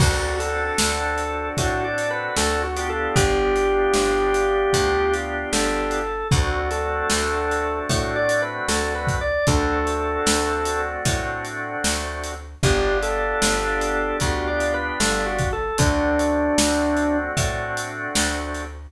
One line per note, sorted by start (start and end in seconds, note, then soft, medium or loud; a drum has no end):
0.00 0.71 D2 medium
0.00 2.63 C4 medium
0.00 2.63 D4 medium
0.00 0.36 F#4 loud
0.00 2.63 F#4 medium
0.00 2.63 A4 medium
0.00 kick loud
0.00 crash loud
0.39 1.49 A4 loud
0.39 closed hi-hat medium
0.78 1.50 D2 medium
0.78 snare loud
1.18 closed hi-hat medium
1.57 2.29 A2 medium
1.57 1.83 F#4 loud
1.57 kick medium
1.57 closed hi-hat loud
1.84 2.09 D5 medium
1.98 closed hi-hat medium
2.11 2.36 B4 loud
2.37 3.08 D2 medium
2.37 2.62 A4 loud
2.37 snare loud
2.63 2.88 F#4 loud
2.76 6.00 B3 medium
2.76 6.00 D4 medium
2.76 6.00 F4 medium
2.76 6.00 G4 medium
2.76 closed hi-hat medium
2.89 3.14 A4 loud
3.16 3.87 G1 medium
3.16 5.13 G4 loud
3.16 kick loud
3.16 closed hi-hat loud
3.56 closed hi-hat medium
3.94 4.66 G1 medium
3.94 snare medium
4.34 closed hi-hat medium
4.73 5.45 D2 medium
4.73 kick medium
4.73 closed hi-hat loud
5.13 closed hi-hat medium
5.53 6.24 G1 medium
5.53 6.28 A4 loud
5.53 snare loud
5.91 closed hi-hat medium
6.31 7.03 D2 medium
6.31 9.16 A3 medium
6.31 9.16 C4 medium
6.31 9.16 D4 medium
6.31 6.67 F#4 loud
6.31 9.16 F#4 medium
6.31 kick loud
6.31 closed hi-hat medium
6.71 7.79 A4 loud
6.71 closed hi-hat medium
7.10 7.82 D2 medium
7.10 snare loud
7.51 closed hi-hat medium
7.89 8.60 A2 medium
7.89 8.14 F#4 medium
7.89 kick medium
7.89 closed hi-hat loud
8.16 8.41 D5 loud
8.29 closed hi-hat medium
8.42 8.67 B4 loud
8.68 9.39 D2 medium
8.68 8.93 A4 loud
8.68 snare loud
8.95 9.20 B4 loud
9.07 kick medium
9.07 closed hi-hat medium
9.21 9.46 D5 loud
9.47 10.19 D2 medium
9.47 12.32 A3 medium
9.47 12.32 C4 medium
9.47 12.32 D4 medium
9.47 12.32 F#4 medium
9.47 10.82 A4 loud
9.47 kick loud
9.47 closed hi-hat medium
9.87 closed hi-hat medium
10.26 10.97 D2 medium
10.26 snare loud
10.65 closed hi-hat medium
11.05 11.76 A2 medium
11.05 kick medium
11.05 closed hi-hat loud
11.45 closed hi-hat medium
11.84 12.55 D2 medium
11.84 snare loud
12.24 closed hi-hat medium
12.63 13.34 G1 loud
12.63 15.47 B3 medium
12.63 15.47 D4 loud
12.63 15.47 F4 medium
12.63 12.98 G4 loud
12.63 15.47 G4 medium
12.63 kick loud
12.63 closed hi-hat medium
13.03 14.17 A4 loud
13.03 closed hi-hat medium
13.42 14.13 G1 medium
13.42 snare loud
13.81 closed hi-hat medium
14.20 14.92 D2 medium
14.20 14.46 F#4 loud
14.20 kick medium
14.20 closed hi-hat medium
14.47 14.72 D5 loud
14.60 closed hi-hat medium
14.74 14.99 B4 loud
15.00 15.71 G1 medium
15.00 15.25 A4 loud
15.00 snare loud
15.26 15.51 F#4 loud
15.38 kick medium
15.38 closed hi-hat medium
15.53 15.78 A4 loud
15.78 16.50 D2 medium
15.78 18.62 A3 medium
15.78 18.62 C4 medium
15.78 18.62 D4 medium
15.78 17.17 D4 loud
15.78 18.62 F#4 medium
15.78 kick loud
15.78 closed hi-hat loud
16.19 closed hi-hat medium
16.58 17.29 D2 medium
16.58 snare loud
16.97 closed hi-hat medium
17.37 18.08 A2 medium
17.37 kick medium
17.37 closed hi-hat loud
17.77 closed hi-hat medium
18.15 18.87 D2 medium
18.15 snare loud
18.54 closed hi-hat medium